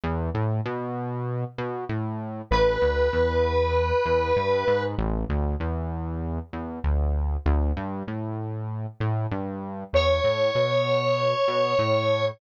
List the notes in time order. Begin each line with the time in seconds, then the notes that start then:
0.03 E2
0.34 A2
0.65 B2
1.58 B2
1.89 A2
2.51 A1 B4
2.82 D2
3.13 E2
4.06 E2
4.36 G2
4.67 G#2
4.98 A1
5.29 D2
5.60 E2
6.53 E2
6.84 D2
7.46 D2
7.77 G2
8.07 A2
9.00 A2
9.31 G2
9.93 E2 C#5
10.24 A2
10.55 B2
11.48 B2
11.79 A2